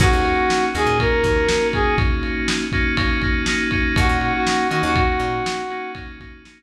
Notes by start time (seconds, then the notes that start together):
0.00 D#2 A#3 C#4 D#4 F#4, kick, crash
0.13 D#2
0.25 ride
0.50 snare
0.74 D#2 A#3 C#4 D#4 F#4 G#4, ride
0.86 A#2
0.99 A#3 C#4 D#4 F#4 A#4, kick, ride
1.24 D#2 A#3 C#4 D#4 F#4, kick, ride
1.48 A#3 C#4 D#4 F#4, snare
1.73 A#3 C#4 D#4 F#4 G#4, kick, ride
1.98 kick, ride
2.23 ride
2.48 snare
2.72 A#3 C#4 D#4 F#4, kick, ride
2.97 A#3 C#4 D#4 F#4, kick, ride
3.22 A#3 C#4 D#4 F#4, kick, ride
3.46 A#3 C#4 D#4 F#4, snare
3.71 A#3 C#4 D#4 F#4, kick, ride
3.96 D#2 A#3 C#4 D#4 F#4, kick, ride
4.09 A#2
4.21 F#4, ride
4.35 F#4
4.47 snare
4.70 D#3 A#3 C#4 D#4 F#4, ride
4.83 D#2 F#4
4.96 F#4, kick, ride
5.20 A#2, ride
5.46 snare
5.70 A#3 C#4 D#4 F#4, ride
5.95 A#3 C#4 D#4 F#4, kick, ride
6.20 A#3 C#4 D#4 F#4, kick, ride
6.45 A#3 C#4 D#4 F#4, snare